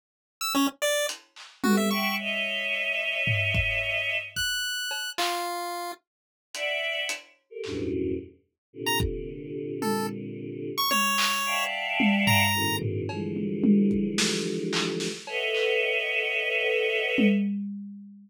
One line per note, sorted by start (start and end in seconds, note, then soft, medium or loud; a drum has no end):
0.41 0.53 E6 medium
0.54 0.67 C#4 loud
0.82 1.06 D5 loud
1.09 closed hi-hat medium
1.36 clap medium
1.64 1.89 G3 medium
1.64 1.89 A3 medium
1.64 1.89 B3 medium
1.64 1.89 C4 medium
1.64 1.76 F#4 medium
1.64 high tom loud
1.77 1.89 E5 medium
1.91 2.16 E5 loud
1.91 2.16 F#5 loud
1.91 2.16 G5 loud
1.91 2.15 C#6 medium
2.19 4.15 C#5 loud
2.19 4.15 D#5 loud
2.19 4.15 E5 loud
3.27 floor tom loud
3.55 kick loud
4.36 5.10 F#6 medium
4.36 kick medium
4.91 cowbell medium
5.18 5.92 F4 medium
5.18 clap loud
6.54 7.03 D5 loud
6.54 7.03 E5 loud
6.54 7.03 F#5 loud
6.54 closed hi-hat medium
7.09 closed hi-hat medium
7.50 7.62 G4 medium
7.50 7.62 A4 medium
7.50 7.62 A#4 medium
7.64 8.13 E2 medium
7.64 8.13 F#2 medium
7.64 8.13 G2 medium
7.64 8.13 A2 medium
7.64 8.13 B2 medium
7.64 clap medium
8.73 10.69 A#2 medium
8.73 10.69 C3 medium
8.73 10.69 D3 medium
8.86 8.99 A#5 medium
9.00 kick loud
9.82 10.07 A4 medium
9.82 high tom medium
10.78 10.90 C#6 medium
10.91 11.64 C#5 loud
10.91 high tom medium
11.18 clap loud
11.45 12.43 D5 medium
11.45 12.43 E5 medium
11.45 12.43 F5 medium
11.45 12.43 F#5 medium
11.45 12.43 G5 medium
11.45 12.43 A5 medium
12.00 high tom loud
12.27 12.76 A#5 loud
12.27 floor tom loud
12.54 13.03 A2 medium
12.54 13.03 B2 medium
12.54 13.03 C#3 medium
12.54 13.03 D#3 medium
12.82 floor tom medium
13.09 15.06 D3 medium
13.09 15.06 E3 medium
13.09 15.06 F3 medium
13.09 15.06 G3 medium
13.09 15.06 G#3 medium
13.09 cowbell medium
13.36 high tom medium
13.64 high tom loud
13.91 kick medium
14.18 snare loud
14.73 clap loud
15.00 snare medium
15.27 17.25 A4 loud
15.27 17.25 B4 loud
15.27 17.25 C#5 loud
15.27 17.25 D#5 loud
15.27 17.25 E5 loud
15.27 17.25 F#5 loud
15.27 cowbell medium
15.55 clap medium
17.18 high tom loud